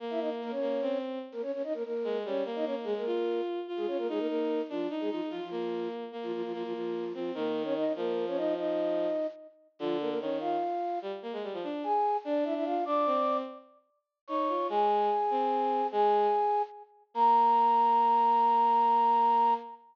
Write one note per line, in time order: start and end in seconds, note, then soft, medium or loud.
0.00 0.52 A#3 loud
0.10 0.20 E4 medium
0.10 0.20 E5 medium
0.20 0.30 D#4 medium
0.20 0.30 D#5 medium
0.42 0.52 A#3 medium
0.42 0.52 A#4 medium
0.51 0.98 C#4 medium
0.51 0.98 C#5 medium
0.61 0.78 A#3 medium
0.82 1.19 C4 loud
1.32 1.42 A#3 medium
1.32 1.42 A#4 medium
1.42 1.52 C#4 medium
1.42 1.52 C#5 medium
1.53 1.62 C#4 medium
1.53 1.62 C#5 medium
1.64 1.73 D#4 medium
1.64 1.73 D#5 medium
1.74 1.83 A#3 medium
1.74 1.83 A#4 medium
1.84 2.18 A#3 medium
1.84 2.18 A#4 medium
2.04 2.23 G#3 loud
2.25 2.42 G3 medium
2.25 2.44 C#4 medium
2.25 2.44 C#5 medium
2.45 2.65 A#3 loud
2.55 2.65 D#4 medium
2.55 2.65 D#5 medium
2.65 2.85 A#3 medium
2.65 2.75 C#4 medium
2.65 2.75 C#5 medium
2.84 2.93 G#3 medium
2.84 3.03 G#3 medium
2.84 2.93 G#4 medium
2.97 3.41 A#3 medium
2.97 3.41 A#4 medium
3.06 3.59 F4 loud
3.68 4.05 F4 medium
3.77 3.86 G#3 medium
3.77 3.86 G#4 medium
3.87 3.97 C#4 medium
3.87 3.97 C#5 medium
3.98 4.08 A#3 medium
3.98 4.08 A#4 medium
4.09 4.19 G#3 medium
4.09 4.59 D#4 loud
4.09 4.19 G#4 medium
4.19 4.27 A#3 medium
4.19 4.27 A#4 medium
4.28 4.62 A#3 medium
4.28 4.62 A#4 medium
4.69 4.88 F3 medium
4.69 4.86 D4 loud
4.69 4.88 F4 medium
4.90 5.09 D#4 loud
5.00 5.10 G#3 medium
5.00 5.10 G#4 medium
5.10 5.21 F3 medium
5.10 5.28 D#4 loud
5.10 5.21 F4 medium
5.30 5.40 F3 medium
5.30 5.40 F4 medium
5.30 5.47 F4 medium
5.42 5.88 F3 medium
5.42 5.88 F4 medium
5.51 6.04 A#3 medium
6.12 6.50 A#3 medium
6.23 6.32 F3 medium
6.23 6.32 F4 medium
6.33 6.42 F3 medium
6.33 6.42 F4 medium
6.44 6.53 F3 medium
6.44 6.53 F4 medium
6.53 6.63 F3 medium
6.53 7.04 A#3 medium
6.53 6.63 F4 medium
6.64 6.73 F3 medium
6.64 6.73 F4 medium
6.73 7.13 F3 medium
6.73 7.13 F4 medium
7.14 7.31 F3 medium
7.14 7.33 C4 medium
7.14 7.31 F4 medium
7.34 7.84 D#3 loud
7.34 7.63 A#3 medium
7.34 7.63 A#4 medium
7.64 7.74 C#4 medium
7.64 7.74 C#5 medium
7.76 7.93 D#4 medium
7.76 7.93 D#5 medium
7.96 9.06 F3 loud
7.96 8.25 A#3 medium
7.96 8.25 A#4 medium
8.27 8.37 C#4 medium
8.27 8.37 C#5 medium
8.36 8.54 D#4 medium
8.36 8.54 D#5 medium
8.57 9.27 D#4 medium
8.57 9.27 D#5 medium
9.79 10.14 D3 loud
9.79 9.97 F3 medium
9.79 9.97 F4 medium
10.00 10.09 A#3 medium
10.00 10.09 A#4 medium
10.09 10.19 A#3 medium
10.09 10.19 A#4 medium
10.20 10.56 D#3 medium
10.20 10.38 C#4 medium
10.20 10.38 C#5 medium
10.40 10.99 F4 medium
10.40 10.99 F5 medium
11.02 11.11 G3 loud
11.22 11.32 A#3 medium
11.33 11.42 G#3 medium
11.43 11.53 G3 medium
11.53 11.63 F3 medium
11.63 11.82 D4 loud
11.84 12.17 G#4 medium
11.84 12.17 G#5 medium
12.24 12.75 D4 loud
12.24 12.44 D4 medium
12.24 12.44 D5 medium
12.44 12.54 E4 medium
12.44 12.54 E5 medium
12.55 12.65 E4 medium
12.55 12.65 E5 medium
12.64 12.84 F4 medium
12.64 12.84 F5 medium
12.85 13.05 D4 loud
12.85 13.37 D5 medium
12.85 13.37 D6 medium
13.06 13.42 C4 loud
14.27 14.48 D#4 medium
14.27 14.67 C#5 medium
14.27 14.67 C#6 medium
14.49 14.67 F4 medium
14.69 15.09 G#3 loud
14.69 15.87 G#4 medium
14.69 15.87 G#5 medium
15.30 15.81 C4 loud
15.92 16.27 G#3 loud
15.92 16.62 G#4 medium
15.92 16.62 G#5 medium
17.14 19.53 A#3 loud
17.14 19.54 A#5 loud